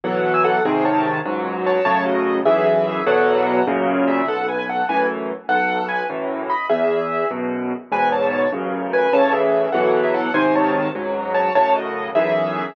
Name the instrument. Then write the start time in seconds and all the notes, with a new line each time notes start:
acoustic grand piano
0.04 B2 E3 F#3 A4 F#5
0.34 G#5 E6
0.44 A4 F#5
0.65 G#2 C3 D#3 C4 G#4
0.85 C#5 A5
1.25 C#2 G#2 F#3
1.66 C#5 A5
1.85 F#2 A2 C#3 C#5 A5
2.06 F#4 D#5
2.45 B1 F#2 E3 G#4 E5
3.06 E2 B2 F#3 A4 F#5
3.46 A4 F#5
3.67 F#2 A#2 C#3
4.08 G#4 E5
4.27 B1 A4 F#5
4.48 B4 G#5
4.58 B4 G#5
4.69 A4 F#5
4.89 F#2 A2 E3 B4 G#5
5.48 B1 A4 F#5
5.88 B4 G#5
6.09 F#2 A2 E3
6.49 D#5 B5
6.69 E2 G#4 E5
7.30 F#2 B2
7.92 E2 G#2 B2 B4 G#5
8.12 C#5 A5
8.52 A1 F#2 C#3
8.93 B4 G#5
9.13 A2 C#3 E3 C#5 A5
9.33 G#4 E5
9.72 B2 E3 F#3 A4 F#5
10.03 G#4 E5
10.14 A4 F#5
10.34 G#2 C3 D#3 C5 G#5
10.55 C#5 A5
10.95 C#2 G#2 F#3
11.34 C#5 A5
11.55 F#2 A2 C#3 C#5 A5
11.75 F#4 D#5
12.15 B1 F#2 E3 G#4 E5